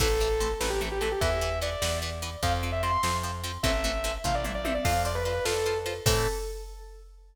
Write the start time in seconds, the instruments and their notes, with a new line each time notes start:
0.00 electric bass (finger) A1, acoustic guitar (steel) E3 A3 C4, lead 2 (sawtooth) A4, kick, crash
0.20 acoustic guitar (steel) E3 A3 C4
0.40 acoustic guitar (steel) E3 A3 C4, ride
0.60 electric bass (finger) A1, acoustic guitar (steel) E3 A3 C4, lead 2 (sawtooth) B4, snare
0.70 lead 2 (sawtooth) G4
0.81 acoustic guitar (steel) E3 A3 C4
0.92 lead 2 (sawtooth) G4
1.01 acoustic guitar (steel) E3 A3 C4, lead 2 (sawtooth) A4, ride
1.12 lead 2 (sawtooth) G4
1.21 electric bass (finger) E2, acoustic guitar (steel) E3 B3, lead 2 (sawtooth) E5, kick, ride
1.41 acoustic guitar (steel) E3 B3
1.61 acoustic guitar (steel) E3 B3, lead 2 (sawtooth) D5, ride
1.82 electric bass (finger) E2, acoustic guitar (steel) E3 B3, snare
2.02 acoustic guitar (steel) E3 B3
2.22 acoustic guitar (steel) E3 B3, ride
2.43 electric bass (finger) F2, acoustic guitar (steel) F3 C4, lead 2 (sawtooth) F5, kick, ride
2.63 acoustic guitar (steel) F3 C4
2.72 lead 2 (sawtooth) E5
2.83 acoustic guitar (steel) F3 C4, lead 2 (sawtooth) C6, ride
3.03 electric bass (finger) F2, acoustic guitar (steel) F3 C4, snare
3.23 acoustic guitar (steel) F3 C4
3.44 acoustic guitar (steel) F3 C4, ride
3.63 electric bass (finger) A1, acoustic guitar (steel) E3 A3 C4, lead 2 (sawtooth) E5, kick, ride
3.84 acoustic guitar (steel) E3 A3 C4
4.04 acoustic guitar (steel) E3 A3 C4, ride
4.24 electric bass (finger) A1, acoustic guitar (steel) E3 A3 C4, lead 2 (sawtooth) F5, kick, floor tom
4.35 lead 2 (sawtooth) D5
4.44 acoustic guitar (steel) E3 A3 C4, mid tom
4.55 lead 2 (sawtooth) D5
4.64 acoustic guitar (steel) E3 A3 C4, lead 2 (sawtooth) E5, high tom
4.74 lead 2 (sawtooth) D5
4.84 electric bass (finger) F2, acoustic guitar (steel) F4 C5, lead 2 (sawtooth) F5, kick, crash
5.05 acoustic guitar (steel) F4 C5, lead 2 (sawtooth) D5
5.15 lead 2 (sawtooth) B4
5.25 acoustic guitar (steel) F4 C5, lead 2 (sawtooth) B4, ride
5.45 electric bass (finger) F2, acoustic guitar (steel) F4 C5, lead 2 (sawtooth) A4, snare
5.66 acoustic guitar (steel) F4 C5
5.86 acoustic guitar (steel) F4 C5, ride
6.06 electric bass (finger) A2, acoustic guitar (steel) E3 A3 C4, lead 2 (sawtooth) A4, kick, crash